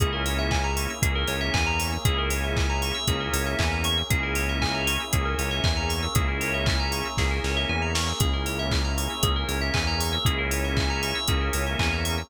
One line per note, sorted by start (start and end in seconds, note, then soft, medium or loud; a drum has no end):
0.00 0.87 C#2 medium
0.00 1.01 A#3 medium
0.00 0.93 A#3 loud
0.00 1.01 C#4 loud
0.00 0.93 C#4 loud
0.00 1.01 E4 loud
0.00 0.93 E4 loud
0.00 0.11 G#4 loud
0.00 1.01 G#4 loud
0.00 0.93 G#4 medium
0.00 kick medium
0.00 closed hi-hat medium
0.13 0.24 A#4 medium
0.26 0.38 C#5 medium
0.26 open hi-hat medium
0.39 0.50 E5 medium
0.51 0.63 G#5 medium
0.51 kick medium
0.51 clap medium
0.64 0.76 A#5 medium
0.77 0.88 C#6 medium
0.77 open hi-hat medium
0.90 1.02 E6 medium
1.02 1.24 C#2 medium
1.02 1.94 A#3 medium
1.02 2.05 A#3 medium
1.02 1.94 C#4 medium
1.02 2.05 C#4 loud
1.02 1.94 E4 medium
1.02 1.94 G#4 medium
1.02 1.14 G#4 medium
1.02 2.05 G#4 loud
1.02 2.05 A#4 medium
1.02 kick medium
1.02 closed hi-hat medium
1.15 1.27 A#4 medium
1.28 1.50 C#2 medium
1.28 1.39 C#5 medium
1.28 open hi-hat medium
1.41 1.52 E5 medium
1.54 1.97 E2 medium
1.54 1.65 G#5 medium
1.54 kick medium
1.54 clap medium
1.66 1.78 A#5 medium
1.79 1.91 C#6 medium
1.79 open hi-hat medium
1.92 2.04 E6 medium
2.05 2.92 C#2 medium
2.05 2.98 A#3 loud
2.05 3.05 A#3 medium
2.05 2.98 C#4 loud
2.05 3.05 C#4 loud
2.05 2.98 E4 loud
2.05 3.08 E4 loud
2.05 2.17 G#4 loud
2.05 2.98 G#4 loud
2.05 3.05 G#4 loud
2.05 kick medium
2.05 closed hi-hat medium
2.18 2.30 A#4 medium
2.30 2.42 C#5 medium
2.30 open hi-hat medium
2.44 2.55 E5 medium
2.56 2.68 G#5 medium
2.56 kick medium
2.56 clap medium
2.69 2.81 A#5 medium
2.82 2.94 C#6 medium
2.82 open hi-hat medium
2.95 3.06 E6 medium
3.06 3.29 C#2 medium
3.06 4.07 A#3 loud
3.06 4.00 A#3 loud
3.06 4.07 C#4 loud
3.06 4.00 C#4 medium
3.06 4.00 E4 loud
3.06 4.07 G#4 loud
3.06 4.00 G#4 medium
3.06 3.19 G#4 medium
3.06 4.07 A#4 loud
3.06 kick medium
3.06 closed hi-hat medium
3.20 3.32 A#4 medium
3.33 3.55 C#2 medium
3.33 3.45 C#5 medium
3.33 open hi-hat medium
3.46 3.58 E5 medium
3.59 4.03 E2 medium
3.59 3.70 G#5 medium
3.59 kick medium
3.59 clap medium
3.72 3.83 A#5 medium
3.84 3.96 C#6 medium
3.84 open hi-hat medium
3.98 4.09 E6 medium
4.10 4.97 C#2 medium
4.10 5.03 A#3 loud
4.10 5.12 A#3 medium
4.10 5.03 C#4 medium
4.10 5.12 C#4 medium
4.10 5.03 E4 loud
4.10 5.14 E4 medium
4.10 4.22 G#4 medium
4.10 5.03 G#4 loud
4.10 5.12 G#4 loud
4.10 kick medium
4.10 closed hi-hat medium
4.23 4.35 A#4 medium
4.35 4.47 C#5 medium
4.35 open hi-hat medium
4.49 4.61 E5 medium
4.62 4.73 G#5 medium
4.62 kick medium
4.62 clap medium
4.74 4.86 A#5 medium
4.87 4.99 C#6 medium
4.87 open hi-hat medium
5.00 5.12 E6 medium
5.13 5.35 C#2 medium
5.13 6.14 A#3 loud
5.13 6.05 A#3 medium
5.13 6.14 C#4 loud
5.13 6.05 C#4 medium
5.13 6.05 E4 medium
5.13 6.14 G#4 loud
5.13 5.24 G#4 medium
5.13 6.05 G#4 medium
5.13 6.14 A#4 loud
5.13 kick medium
5.13 closed hi-hat medium
5.25 5.37 A#4 medium
5.38 5.60 C#2 medium
5.38 5.50 C#5 medium
5.38 open hi-hat medium
5.51 5.63 E5 medium
5.64 6.08 E2 medium
5.64 5.76 G#5 medium
5.64 kick medium
5.64 clap medium
5.77 5.88 A#5 medium
5.89 6.01 C#6 medium
5.89 open hi-hat medium
6.03 6.14 E6 medium
6.15 7.03 C#2 medium
6.15 7.08 A#3 loud
6.15 7.17 A#3 medium
6.15 7.08 C#4 loud
6.15 7.17 C#4 medium
6.15 7.08 E4 loud
6.15 7.18 E4 medium
6.15 6.27 G#4 loud
6.15 7.08 G#4 medium
6.15 7.17 G#4 loud
6.15 kick medium
6.15 closed hi-hat medium
6.28 6.40 A#4 medium
6.41 6.52 C#5 medium
6.41 open hi-hat medium
6.54 6.66 E5 medium
6.66 6.78 G#5 medium
6.66 kick medium
6.66 clap medium
6.80 6.91 A#5 medium
6.92 7.04 C#6 medium
6.92 open hi-hat medium
7.05 7.17 E6 medium
7.17 7.40 C#2 medium
7.17 8.19 A#3 loud
7.17 8.10 A#3 medium
7.17 8.19 C#4 medium
7.17 8.10 C#4 medium
7.17 8.10 E4 medium
7.17 8.19 G#4 loud
7.17 8.10 G#4 medium
7.17 7.30 G#4 medium
7.17 8.19 A#4 loud
7.17 kick medium
7.17 snare medium
7.31 7.43 A#4 medium
7.44 7.65 C#2 medium
7.44 7.56 C#5 medium
7.44 snare medium
7.57 7.68 E5 medium
7.69 8.13 E2 medium
7.69 7.81 G#5 medium
7.82 7.94 A#5 medium
7.95 8.06 C#6 medium
7.95 snare medium
8.08 8.20 E6 medium
8.20 9.08 C#2 medium
8.20 9.22 A#3 medium
8.20 9.13 A#3 loud
8.20 9.22 C#4 loud
8.20 9.13 C#4 loud
8.20 9.22 E4 loud
8.20 9.13 E4 loud
8.20 8.32 G#4 loud
8.20 9.22 G#4 loud
8.20 9.13 G#4 medium
8.20 kick medium
8.20 closed hi-hat medium
8.33 8.45 A#4 medium
8.46 8.58 C#5 medium
8.46 open hi-hat medium
8.59 8.71 E5 medium
8.71 8.84 G#5 medium
8.71 kick medium
8.71 clap medium
8.84 8.96 A#5 medium
8.98 9.09 C#6 medium
8.98 open hi-hat medium
9.10 9.22 E6 medium
9.23 9.45 C#2 medium
9.23 10.16 A#3 medium
9.23 10.24 A#3 medium
9.23 10.16 C#4 medium
9.23 10.24 C#4 loud
9.23 10.16 E4 medium
9.23 9.34 G#4 medium
9.23 10.16 G#4 medium
9.23 10.24 G#4 loud
9.23 10.25 A#4 medium
9.23 kick medium
9.23 closed hi-hat medium
9.36 9.48 A#4 medium
9.48 9.71 C#2 medium
9.48 9.60 C#5 medium
9.48 open hi-hat medium
9.61 9.73 E5 medium
9.74 10.18 E2 medium
9.74 9.86 G#5 medium
9.74 kick medium
9.74 clap medium
9.87 9.99 A#5 medium
10.00 10.11 C#6 medium
10.00 open hi-hat medium
10.13 10.24 E6 medium
10.25 11.13 C#2 medium
10.25 11.26 A#3 medium
10.25 11.18 A#3 loud
10.25 11.26 C#4 loud
10.25 11.18 C#4 loud
10.25 11.26 E4 loud
10.25 11.18 E4 loud
10.25 11.26 G#4 loud
10.25 10.37 G#4 loud
10.25 11.18 G#4 loud
10.25 kick medium
10.25 closed hi-hat medium
10.38 10.50 A#4 medium
10.51 10.63 C#5 medium
10.51 open hi-hat medium
10.64 10.76 E5 medium
10.77 10.88 G#5 medium
10.77 kick medium
10.77 clap medium
10.90 11.01 A#5 medium
11.03 11.14 C#6 medium
11.03 open hi-hat medium
11.15 11.27 E6 medium
11.28 11.50 C#2 medium
11.28 12.29 A#3 loud
11.28 12.20 A#3 loud
11.28 12.29 C#4 loud
11.28 12.20 C#4 medium
11.28 12.20 E4 loud
11.28 12.29 G#4 loud
11.28 12.20 G#4 medium
11.28 11.40 G#4 medium
11.28 12.29 A#4 loud
11.28 kick medium
11.28 closed hi-hat medium
11.41 11.52 A#4 medium
11.53 11.76 C#2 medium
11.53 11.65 C#5 medium
11.53 open hi-hat medium
11.67 11.78 E5 medium
11.79 12.23 E2 medium
11.79 11.91 G#5 medium
11.79 kick medium
11.79 clap medium
11.93 12.04 A#5 medium
12.05 12.16 C#6 medium
12.05 open hi-hat medium
12.18 12.29 E6 medium